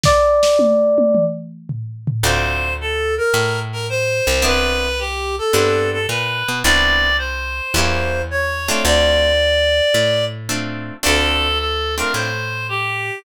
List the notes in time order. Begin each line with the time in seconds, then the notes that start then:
0.03 D5, kick, snare
0.43 snare
0.59 high tom
0.98 high tom
1.15 mid tom
1.69 floor tom
2.07 floor tom
2.23 D2 C4 D4 F4 A4 C5
2.81 A4
3.18 A#4
3.34 A2
3.72 A#4
3.89 C5
4.27 C2
4.42 B3 C4 D4 E4 B4
4.99 G4
5.38 A4
5.53 G2 B3 C4 D4 E4
5.93 A4
6.09 A#2 B4
6.48 B2
6.64 C2 B3 C4 D4 E4 D5
7.18 C5
7.74 E2 A#3 C#4 E4 G4
8.31 C#5
8.68 A3 C4 D4 F4
8.85 D2 D5
9.94 A2
10.49 A3 C4 D4 F4
11.03 D2 A3 C4 D4 F4 A4
11.59 A4
11.98 A3 C4 D4 F4 A#4
12.14 A2 C5
12.69 G4